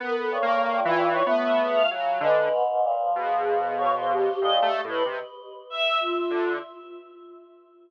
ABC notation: X:1
M:7/8
L:1/16
Q:1/4=95
K:none
V:1 name="Lead 1 (square)"
(3B,4 ^A,4 E,4 B,4 ^F,2 | D,2 z4 B,,8 | (3A,,2 A,2 A,,2 C, z7 D,2 |]
V:2 name="Choir Aahs"
z2 G,,6 A,4 ^C,2 | ^G,2 ^G,,2 ^A,, F,9 | ^A,,2 z12 |]
V:3 name="Choir Aahs"
^A =A ^c3 F2 c z e ^G f z2 | B3 z3 ^G4 ^c =c =G2 | ^d G2 B z4 e2 F4 |]